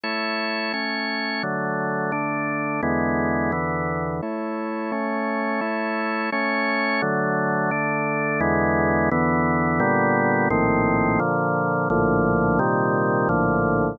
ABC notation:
X:1
M:2/2
L:1/8
Q:1/2=86
K:A
V:1 name="Drawbar Organ"
[A,Ec]4 [A,Cc]4 | [D,F,A,]4 [D,A,D]4 | [E,,D,G,B,]4 [E,,D,E,B,]4 | [A,Ec]4 [A,Cc]4 |
[A,Ec]4 [A,Cc]4 | [D,F,A,]4 [D,A,D]4 | [E,,D,G,B,]4 [E,,D,E,B,]4 | [K:Bb] [B,,D,G,=B,]4 [_B,,,A,,E,C]4 |
[B,,D,F,]4 [B,,,A,,D,F,]4 | [B,,C,E,G,]4 [B,,,A,,D,F,]4 |]